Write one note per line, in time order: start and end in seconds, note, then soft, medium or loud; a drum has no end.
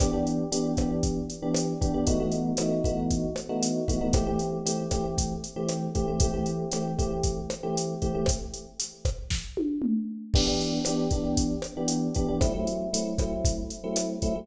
0.00 0.10 E3 medium
0.00 0.10 B3 medium
0.00 0.10 D4 medium
0.00 0.10 G4 medium
0.00 kick loud
0.00 cross-stick loud
0.00 closed hi-hat loud
0.13 0.44 E3 medium
0.13 0.44 B3 medium
0.13 0.44 D4 medium
0.13 0.44 G4 medium
0.27 closed hi-hat medium
0.52 0.72 E3 medium
0.52 0.72 B3 medium
0.52 0.72 D4 medium
0.52 0.72 G4 medium
0.52 closed hi-hat loud
0.77 1.19 E3 medium
0.77 1.19 B3 medium
0.77 1.19 D4 medium
0.77 1.19 G4 medium
0.77 kick medium
0.77 cross-stick medium
0.77 closed hi-hat medium
1.03 kick medium
1.03 closed hi-hat medium
1.30 closed hi-hat medium
1.42 1.73 E3 medium
1.42 1.73 B3 medium
1.42 1.73 D4 medium
1.42 1.73 G4 medium
1.54 cross-stick medium
1.54 closed hi-hat loud
1.81 1.91 E3 medium
1.81 1.91 B3 medium
1.81 1.91 D4 medium
1.81 1.91 G4 medium
1.81 kick medium
1.81 closed hi-hat medium
1.94 2.04 E3 medium
1.94 2.04 B3 medium
1.94 2.04 D4 medium
1.94 2.04 G4 medium
2.07 2.17 E3 medium
2.07 2.17 A3 medium
2.07 2.17 B3 medium
2.07 2.17 D#4 medium
2.07 2.17 F#4 medium
2.07 kick medium
2.07 closed hi-hat loud
2.20 2.51 E3 medium
2.20 2.51 A3 medium
2.20 2.51 B3 medium
2.20 2.51 D#4 medium
2.20 2.51 F#4 medium
2.32 closed hi-hat medium
2.57 2.79 E3 medium
2.57 2.79 A3 medium
2.57 2.79 B3 medium
2.57 2.79 D#4 medium
2.57 2.79 F#4 medium
2.57 cross-stick loud
2.57 closed hi-hat loud
2.84 3.26 E3 medium
2.84 3.26 A3 medium
2.84 3.26 B3 medium
2.84 3.26 D#4 medium
2.84 3.26 F#4 medium
2.84 kick medium
2.84 closed hi-hat medium
3.11 kick medium
3.11 closed hi-hat medium
3.36 cross-stick medium
3.36 closed hi-hat medium
3.49 3.80 E3 medium
3.49 3.80 A3 medium
3.49 3.80 B3 medium
3.49 3.80 D#4 medium
3.49 3.80 F#4 medium
3.63 closed hi-hat loud
3.88 3.98 E3 medium
3.88 3.98 A3 medium
3.88 3.98 B3 medium
3.88 3.98 D#4 medium
3.88 3.98 F#4 medium
3.88 kick medium
3.88 closed hi-hat medium
4.01 4.11 E3 medium
4.01 4.11 A3 medium
4.01 4.11 B3 medium
4.01 4.11 D#4 medium
4.01 4.11 F#4 medium
4.13 4.24 E3 medium
4.13 4.24 A3 medium
4.13 4.24 C4 medium
4.13 4.24 G4 medium
4.13 kick loud
4.13 cross-stick loud
4.13 closed hi-hat loud
4.27 4.58 E3 medium
4.27 4.58 A3 medium
4.27 4.58 C4 medium
4.27 4.58 G4 medium
4.39 closed hi-hat medium
4.66 4.86 E3 medium
4.66 4.86 A3 medium
4.66 4.86 C4 medium
4.66 4.86 G4 medium
4.66 closed hi-hat loud
4.91 5.33 E3 medium
4.91 5.33 A3 medium
4.91 5.33 C4 medium
4.91 5.33 G4 medium
4.91 kick medium
4.91 cross-stick medium
4.91 closed hi-hat medium
5.18 kick medium
5.18 closed hi-hat loud
5.44 closed hi-hat medium
5.56 5.87 E3 medium
5.56 5.87 A3 medium
5.56 5.87 C4 medium
5.56 5.87 G4 medium
5.69 cross-stick medium
5.69 closed hi-hat medium
5.95 6.05 E3 medium
5.95 6.05 A3 medium
5.95 6.05 C4 medium
5.95 6.05 G4 medium
5.95 kick medium
5.95 closed hi-hat medium
6.08 6.18 E3 medium
6.08 6.18 A3 medium
6.08 6.18 C4 medium
6.08 6.18 G4 medium
6.20 6.31 E3 medium
6.20 6.31 A3 medium
6.20 6.31 C4 medium
6.20 6.31 G4 medium
6.20 kick loud
6.20 closed hi-hat loud
6.34 6.65 E3 medium
6.34 6.65 A3 medium
6.34 6.65 C4 medium
6.34 6.65 G4 medium
6.46 closed hi-hat medium
6.72 6.93 E3 medium
6.72 6.93 A3 medium
6.72 6.93 C4 medium
6.72 6.93 G4 medium
6.72 cross-stick medium
6.72 closed hi-hat loud
6.98 7.40 E3 medium
6.98 7.40 A3 medium
6.98 7.40 C4 medium
6.98 7.40 G4 medium
6.98 kick medium
6.98 closed hi-hat medium
7.23 kick medium
7.23 closed hi-hat loud
7.50 cross-stick loud
7.50 closed hi-hat medium
7.63 7.94 E3 medium
7.63 7.94 A3 medium
7.63 7.94 C4 medium
7.63 7.94 G4 medium
7.77 closed hi-hat loud
8.02 8.12 E3 medium
8.02 8.12 A3 medium
8.02 8.12 C4 medium
8.02 8.12 G4 medium
8.02 kick medium
8.02 closed hi-hat medium
8.15 8.25 E3 medium
8.15 8.25 A3 medium
8.15 8.25 C4 medium
8.15 8.25 G4 medium
8.26 kick medium
8.26 cross-stick loud
8.26 closed hi-hat loud
8.54 closed hi-hat medium
8.80 closed hi-hat loud
9.05 kick medium
9.05 cross-stick medium
9.05 closed hi-hat medium
9.30 kick medium
9.30 snare medium
9.57 high tom medium
9.82 mid tom loud
10.34 10.45 E3 medium
10.34 10.45 B3 medium
10.34 10.45 D4 medium
10.34 10.45 G4 medium
10.34 kick loud
10.34 crash loud
10.47 10.78 E3 medium
10.47 10.78 B3 medium
10.47 10.78 D4 medium
10.47 10.78 G4 medium
10.61 closed hi-hat medium
10.85 11.07 E3 medium
10.85 11.07 B3 medium
10.85 11.07 D4 medium
10.85 11.07 G4 medium
10.85 cross-stick medium
10.85 closed hi-hat loud
11.11 11.53 E3 medium
11.11 11.53 B3 medium
11.11 11.53 D4 medium
11.11 11.53 G4 medium
11.11 kick medium
11.11 closed hi-hat medium
11.37 kick medium
11.37 closed hi-hat loud
11.62 cross-stick medium
11.62 closed hi-hat medium
11.77 12.08 E3 medium
11.77 12.08 B3 medium
11.77 12.08 D4 medium
11.77 12.08 G4 medium
11.88 closed hi-hat loud
12.15 12.26 E3 medium
12.15 12.26 B3 medium
12.15 12.26 D4 medium
12.15 12.26 G4 medium
12.15 kick medium
12.15 closed hi-hat medium
12.28 12.39 E3 medium
12.28 12.39 B3 medium
12.28 12.39 D4 medium
12.28 12.39 G4 medium
12.41 12.52 F#3 medium
12.41 12.52 A3 medium
12.41 12.52 C4 medium
12.41 12.52 E4 medium
12.41 kick loud
12.41 cross-stick loud
12.41 closed hi-hat medium
12.54 12.85 F#3 medium
12.54 12.85 A3 medium
12.54 12.85 C4 medium
12.54 12.85 E4 medium
12.67 closed hi-hat medium
12.93 13.14 F#3 medium
12.93 13.14 A3 medium
12.93 13.14 C4 medium
12.93 13.14 E4 medium
12.93 closed hi-hat loud
13.18 13.60 F#3 medium
13.18 13.60 A3 medium
13.18 13.60 C4 medium
13.18 13.60 E4 medium
13.18 kick medium
13.18 cross-stick medium
13.18 closed hi-hat medium
13.45 kick loud
13.45 closed hi-hat loud
13.70 closed hi-hat medium
13.84 14.15 F#3 medium
13.84 14.15 A3 medium
13.84 14.15 C4 medium
13.84 14.15 E4 medium
13.96 cross-stick medium
13.96 closed hi-hat loud
14.22 14.33 F#3 medium
14.22 14.33 A3 medium
14.22 14.33 C4 medium
14.22 14.33 E4 medium
14.22 kick medium
14.22 closed hi-hat medium
14.35 14.46 F#3 medium
14.35 14.46 A3 medium
14.35 14.46 C4 medium
14.35 14.46 E4 medium